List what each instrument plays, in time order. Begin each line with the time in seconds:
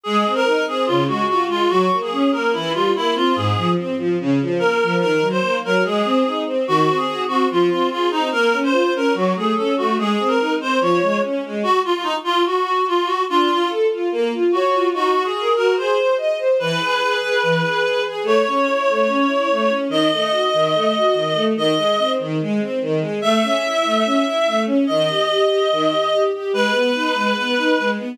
0.03 string ensemble 1 G#3, clarinet G#4
0.25 string ensemble 1 C4
0.35 clarinet A#4
0.45 string ensemble 1 D#4
0.68 string ensemble 1 C4, clarinet G#4
0.86 string ensemble 1 C#3, clarinet F4
1.07 string ensemble 1 G#3, clarinet F#4
1.28 string ensemble 1 F4, clarinet F#4
1.47 string ensemble 1 G#3, clarinet F4
1.69 string ensemble 1 F#3, clarinet F#4
1.91 string ensemble 1 A#3
2.02 clarinet G#4
2.11 string ensemble 1 C#4
2.32 string ensemble 1 A#3, clarinet A#4
2.53 string ensemble 1 E3, clarinet E4
2.73 string ensemble 1 G3, clarinet F4
2.96 string ensemble 1 A#3, clarinet E4
3.14 string ensemble 1 C4, clarinet F4
3.35 string ensemble 1 G#2, clarinet G#4
3.56 string ensemble 1 F3
3.76 string ensemble 1 C4
3.98 string ensemble 1 F3
4.20 string ensemble 1 C#3
4.41 string ensemble 1 F3
4.59 string ensemble 1 A#3, clarinet A#4
4.82 string ensemble 1 F3
5.00 string ensemble 1 D#3, clarinet A#4
5.21 string ensemble 1 F#3
5.30 clarinet C5
5.41 string ensemble 1 A#3
5.64 string ensemble 1 F#3, clarinet A#4
5.84 string ensemble 1 G#3, clarinet G#4
6.05 string ensemble 1 C4
6.25 string ensemble 1 D#4
6.46 string ensemble 1 C4
6.67 string ensemble 1 D#3, clarinet F#4
6.87 string ensemble 1 C4
6.96 clarinet G#4
7.06 string ensemble 1 F#4
7.28 string ensemble 1 C4, clarinet F#4
7.51 string ensemble 1 F3, clarinet F4
7.70 string ensemble 1 C4, clarinet F4
7.90 clarinet F4, string ensemble 1 G#4
8.10 string ensemble 1 C4, clarinet D#4
8.32 string ensemble 1 A#3, clarinet A#4
8.52 string ensemble 1 C#4
8.63 clarinet C5
8.72 string ensemble 1 F4
8.95 string ensemble 1 C#4, clarinet A#4
9.14 string ensemble 1 F#3, clarinet F#4
9.35 string ensemble 1 A3, clarinet G#4
9.56 string ensemble 1 C#4, clarinet A4
9.77 string ensemble 1 A3, clarinet F#4
9.98 string ensemble 1 G#3, clarinet G#4
10.19 string ensemble 1 C4
10.28 clarinet A#4
10.39 string ensemble 1 D#4
10.60 string ensemble 1 C4, clarinet C5
10.81 string ensemble 1 F3, clarinet C#5
11.02 string ensemble 1 G#3
11.23 string ensemble 1 C#4
11.44 string ensemble 1 G#3
11.63 clarinet F#4
11.84 clarinet F4
11.94 clarinet F4
12.03 clarinet D#4
12.24 clarinet F4
12.46 clarinet F#4
12.88 clarinet F4
13.06 clarinet F#4
13.29 string ensemble 1 D4, clarinet F4
13.49 string ensemble 1 F4
13.68 string ensemble 1 A4
13.91 string ensemble 1 F4
14.12 string ensemble 1 A#3
14.33 string ensemble 1 F4
14.52 clarinet F#4, string ensemble 1 C#5
14.74 string ensemble 1 F4
14.93 string ensemble 1 D#4, clarinet F#4
15.15 string ensemble 1 F#4
15.24 clarinet G#4
15.36 string ensemble 1 A#4
15.56 string ensemble 1 F#4, clarinet A#4
15.77 string ensemble 1 G#4, clarinet C5
15.98 string ensemble 1 C5
16.18 string ensemble 1 D#5
16.38 string ensemble 1 C5
16.59 string ensemble 1 E3, clarinet B4
16.81 string ensemble 1 G#4
17.01 string ensemble 1 G#4
17.22 string ensemble 1 G#4
17.43 string ensemble 1 E3
17.63 string ensemble 1 G#4
17.83 string ensemble 1 G#4
18.05 string ensemble 1 G#4
18.23 string ensemble 1 A3, clarinet C#5
18.47 string ensemble 1 C#4
18.67 string ensemble 1 E4
18.89 string ensemble 1 A3
19.06 string ensemble 1 C#4
19.27 string ensemble 1 E4
19.51 string ensemble 1 A3
19.68 string ensemble 1 C#4
19.89 string ensemble 1 D#3, clarinet D#5
20.12 string ensemble 1 A3
20.30 string ensemble 1 F#4
20.54 string ensemble 1 D#3
20.74 string ensemble 1 A3
20.96 string ensemble 1 F#4
21.14 string ensemble 1 D#3
21.34 string ensemble 1 A3
21.56 string ensemble 1 D#3, clarinet D#5
21.77 string ensemble 1 G#3
21.98 string ensemble 1 C4
22.19 string ensemble 1 D#3
22.41 string ensemble 1 G#3
22.61 string ensemble 1 C4
22.81 string ensemble 1 D#3
23.00 string ensemble 1 G#3
23.22 string ensemble 1 A3, clarinet E5
23.43 string ensemble 1 C#4
23.64 string ensemble 1 E4
23.84 string ensemble 1 A3
24.05 string ensemble 1 C#4
24.25 string ensemble 1 E4
24.47 string ensemble 1 A3
24.66 string ensemble 1 C#4
24.87 string ensemble 1 D#3, clarinet D#5
25.08 string ensemble 1 G4
25.28 string ensemble 1 G4
25.48 string ensemble 1 G4
25.72 string ensemble 1 D#3
25.90 string ensemble 1 G4
26.12 string ensemble 1 G4
26.33 string ensemble 1 G4
26.53 string ensemble 1 G#3, clarinet B4
26.72 string ensemble 1 B3
26.94 string ensemble 1 D#4
27.14 string ensemble 1 G#3
27.36 string ensemble 1 B3
27.57 string ensemble 1 D#4
27.79 string ensemble 1 G#3
27.98 string ensemble 1 B3